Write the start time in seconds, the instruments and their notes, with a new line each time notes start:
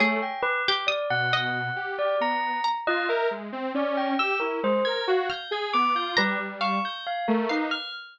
0.00 lead 2 (sawtooth) A3, pizzicato strings G#4, tubular bells C#5
0.22 tubular bells G5
0.43 tubular bells B4
0.68 pizzicato strings G4
0.87 tubular bells D5, pizzicato strings D#6
1.10 lead 2 (sawtooth) B2, tubular bells F#5
1.33 pizzicato strings D#5
1.76 lead 2 (sawtooth) G4
1.99 tubular bells D5
2.20 lead 2 (sawtooth) B3, tubular bells A#5
2.64 pizzicato strings A#5
2.87 lead 2 (sawtooth) F4, tubular bells D#5
3.09 lead 2 (sawtooth) A#4, tubular bells E5
3.31 lead 2 (sawtooth) G#3
3.52 lead 2 (sawtooth) C4
3.74 lead 2 (sawtooth) C#4, tubular bells D5
3.97 tubular bells G5
4.19 lead 2 (sawtooth) G4, tubular bells E6
4.40 lead 2 (sawtooth) E4, tubular bells A#4
4.63 lead 2 (sawtooth) G#3, tubular bells C5
4.85 lead 2 (sawtooth) A#4, tubular bells G#6
5.07 lead 2 (sawtooth) F#4, tubular bells F5
5.30 pizzicato strings F6, tubular bells G6
5.51 lead 2 (sawtooth) G#4, tubular bells G#6
5.73 lead 2 (sawtooth) B3, tubular bells D6
5.95 lead 2 (sawtooth) F4, tubular bells G6
6.17 lead 2 (sawtooth) G3, tubular bells B4, pizzicato strings A#5
6.39 lead 2 (sawtooth) G3
6.61 pizzicato strings F5, tubular bells C#6
6.85 tubular bells G6
7.07 tubular bells F5
7.28 lead 2 (sawtooth) A3, tubular bells A#4
7.49 lead 2 (sawtooth) D#4, tubular bells B4, pizzicato strings F5
7.71 tubular bells F6